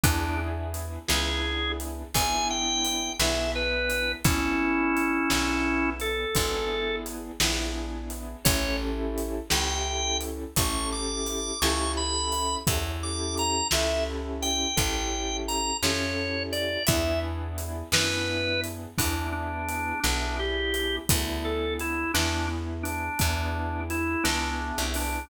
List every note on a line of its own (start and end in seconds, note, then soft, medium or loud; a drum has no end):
0.04 0.98 E2 medium
0.04 0.99 B3 medium
0.04 0.38 D4 loud
0.04 0.99 D4 medium
0.04 0.99 E4 loud
0.04 0.99 G#4 loud
0.04 kick loud
0.04 closed hi-hat loud
0.74 closed hi-hat medium
1.08 2.04 C#2 medium
1.08 2.03 B3 medium
1.08 2.03 D4 medium
1.08 2.03 E4 medium
1.08 2.03 G#4 medium
1.08 1.72 G#4 loud
1.08 snare loud
1.80 closed hi-hat medium
2.14 3.09 G#1 medium
2.14 3.10 B3 medium
2.14 3.10 D4 medium
2.14 3.10 E4 medium
2.14 3.10 G#4 medium
2.14 2.48 G#5 loud
2.14 kick medium
2.14 closed hi-hat loud
2.50 3.13 G5 loud
2.85 closed hi-hat medium
3.19 4.14 B1 medium
3.19 4.15 B3 medium
3.19 4.15 D4 medium
3.19 4.15 E4 medium
3.19 4.15 G#4 medium
3.19 3.51 E5 loud
3.19 snare loud
3.55 4.12 B4 loud
3.90 closed hi-hat medium
4.25 5.19 G#1 medium
4.25 5.20 B3 medium
4.25 5.90 C#4 loud
4.25 5.20 D4 medium
4.25 5.90 E4 loud
4.25 5.20 E4 medium
4.25 5.20 G#4 medium
4.25 kick loud
4.25 closed hi-hat loud
4.97 closed hi-hat medium
5.30 6.26 B1 medium
5.30 6.25 B3 medium
5.30 6.25 D4 medium
5.30 6.25 E4 medium
5.30 6.25 G#4 medium
5.30 snare loud
6.00 6.96 A4 loud
6.00 closed hi-hat medium
6.35 7.31 G#1 medium
6.35 7.31 B3 medium
6.35 7.31 D4 medium
6.35 7.31 E4 medium
6.35 7.31 G#4 medium
6.35 kick medium
6.35 closed hi-hat medium
7.06 closed hi-hat medium
7.40 8.35 A#1 medium
7.40 8.35 B3 medium
7.40 8.35 D4 medium
7.40 8.35 E4 medium
7.40 8.35 G#4 medium
7.40 snare loud
8.10 closed hi-hat medium
8.45 9.41 A1 medium
8.45 9.40 C#4 loud
8.45 9.40 E4 loud
8.45 9.40 G4 medium
8.45 9.40 A4 medium
8.45 8.77 C#5 loud
8.45 kick loud
8.45 closed hi-hat loud
9.18 closed hi-hat medium
9.50 10.46 C#2 medium
9.50 10.45 C#4 medium
9.50 10.45 E4 medium
9.50 10.45 G4 medium
9.50 10.45 A4 medium
9.50 10.18 G5 loud
9.50 snare loud
10.21 closed hi-hat medium
10.56 11.52 A1 medium
10.56 11.52 C#4 medium
10.56 11.52 E4 medium
10.56 11.52 G4 medium
10.56 11.52 A4 medium
10.56 10.90 C#6 medium
10.56 kick medium
10.56 closed hi-hat loud
10.92 11.60 D6 loud
11.26 closed hi-hat medium
11.62 12.57 C#2 medium
11.62 12.57 C#4 medium
11.62 12.57 E4 medium
11.62 12.57 G4 medium
11.62 12.57 A4 medium
11.62 11.92 C#6 loud
11.62 snare loud
11.97 12.56 B5 loud
12.32 closed hi-hat medium
12.67 13.62 E2 medium
12.67 13.62 C#4 medium
12.67 13.62 E4 medium
12.67 13.62 G4 medium
12.67 13.62 A4 medium
12.67 kick loud
12.67 closed hi-hat loud
13.03 13.35 D6 loud
13.37 13.68 A#5 loud
13.37 closed hi-hat medium
13.71 14.67 C#2 medium
13.71 14.67 C#4 medium
13.71 14.67 E4 medium
13.71 14.67 G4 medium
13.71 14.67 A4 medium
13.71 14.04 E5 loud
13.71 snare loud
14.42 15.37 G5 loud
14.42 closed hi-hat medium
14.76 15.72 A1 medium
14.76 15.71 C#4 medium
14.76 15.71 E4 medium
14.76 15.71 G4 medium
14.76 15.71 A4 medium
14.76 kick medium
14.76 closed hi-hat medium
15.48 15.77 A#5 medium
15.48 closed hi-hat medium
15.83 16.77 F2 medium
15.83 16.78 C#4 medium
15.83 16.78 E4 medium
15.83 16.78 G4 medium
15.83 16.78 A4 medium
15.83 16.43 C#5 loud
15.83 snare loud
16.52 16.83 D5 loud
16.52 closed hi-hat medium
16.87 17.83 E2 medium
16.87 17.83 B3 medium
16.87 17.83 D4 medium
16.87 17.83 E4 loud
16.87 17.83 G#4 medium
16.87 17.20 E5 loud
16.87 kick loud
16.87 closed hi-hat loud
17.58 closed hi-hat medium
17.92 18.87 F#2 medium
17.92 18.89 B3 medium
17.92 18.89 D4 medium
17.92 18.89 E4 medium
17.92 18.89 G#4 medium
17.92 18.61 B4 loud
17.92 snare loud
18.64 closed hi-hat medium
18.98 19.93 E2 medium
18.98 19.94 B3 medium
18.98 19.27 D4 medium
18.98 19.94 D4 medium
18.98 19.94 E4 medium
18.98 19.94 G#4 medium
18.98 kick medium
18.98 closed hi-hat loud
19.32 20.00 D4 loud
19.69 closed hi-hat medium
20.03 20.99 B1 medium
20.03 20.99 B3 medium
20.03 20.36 D4 loud
20.03 20.99 D4 medium
20.03 20.99 E4 medium
20.03 20.99 G#4 medium
20.03 snare medium
20.39 20.96 G4 medium
20.74 closed hi-hat medium
21.09 22.05 D2 medium
21.09 22.04 B3 medium
21.09 22.04 D4 medium
21.09 22.04 E4 medium
21.09 22.04 G#4 medium
21.09 kick loud
21.09 closed hi-hat loud
21.45 21.74 A4 medium
21.80 22.12 E4 medium
21.80 closed hi-hat medium
22.14 23.09 E2 medium
22.14 23.09 B3 medium
22.14 22.47 D4 loud
22.14 23.09 D4 medium
22.14 23.09 E4 medium
22.14 23.09 G#4 medium
22.14 snare loud
22.83 23.80 D4 loud
22.83 closed hi-hat medium
23.19 24.16 E2 medium
23.19 24.14 B3 medium
23.19 24.14 D4 medium
23.19 24.14 E4 medium
23.19 24.14 G#4 medium
23.19 kick medium
23.19 closed hi-hat medium
23.90 24.23 E4 medium
23.90 closed hi-hat medium
24.24 24.72 C#2 medium
24.24 25.19 B3 medium
24.24 24.82 D4 loud
24.24 25.19 D4 medium
24.24 25.19 E4 medium
24.24 25.19 G#4 medium
24.24 snare loud
24.78 25.25 C2 medium
24.94 25.25 D4 medium
24.94 open hi-hat medium